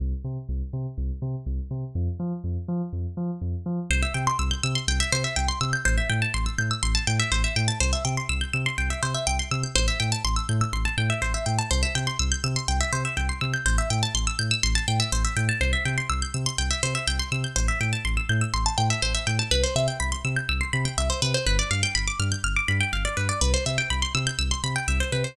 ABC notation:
X:1
M:4/4
L:1/16
Q:1/4=123
K:C
V:1 name="Pizzicato Strings"
z16 | z16 | c e g c' e' g' e' c' g e c e g c' e' g' | c e g a c' e' g' e' c' a g e c e g a |
c e g c' e' g' e' c' g e c e g c' e' g' | c e g a c' e' g' e' c' a g e c e g a | c e g c' e' g' e' c' g e c e g c' e' g' | c e g a c' e' g' e' c' a g e c e g a |
c e g c' e' g' e' c' g e c e g c' e' g' | c e g a c' e' g' e' c' a g e c e g a | B c e g b c' e' g' e' c' b g e c B c | B d f g b d' f' g' f' d' b g f d B d |
B c e g b c' e' g' e' c' b g e c B c |]
V:2 name="Synth Bass 2" clef=bass
C,,2 C,2 C,,2 C,2 C,,2 C,2 C,,2 C,2 | F,,2 F,2 F,,2 F,2 F,,2 F,2 F,,2 F,2 | C,,2 C,2 C,,2 C,2 C,,2 C,2 C,,2 C,2 | A,,,2 A,,2 A,,,2 A,,2 A,,,2 A,,2 A,,,2 A,,2 |
C,,2 C,2 C,,2 C,2 C,,2 C,2 C,,2 C,2 | A,,,2 A,,2 A,,,2 A,,2 A,,,2 A,,2 A,,,2 A,,2 | C,,2 C,2 C,,2 C,2 C,,2 C,2 C,,2 C,2 | A,,,2 A,,2 A,,,2 A,,2 A,,,2 A,,2 A,,,2 A,,2 |
C,,2 C,2 C,,2 C,2 C,,2 C,2 C,,2 C,2 | A,,,2 A,,2 A,,,2 A,,2 A,,,2 A,,2 A,,,2 A,,2 | C,,2 C,2 C,,2 C,2 C,,2 C,2 C,,2 C,2 | G,,,2 G,,2 G,,,2 G,,2 G,,,2 G,,2 G,,,2 G,,2 |
C,,2 C,2 C,,2 C,2 C,,2 C,2 C,,2 C,2 |]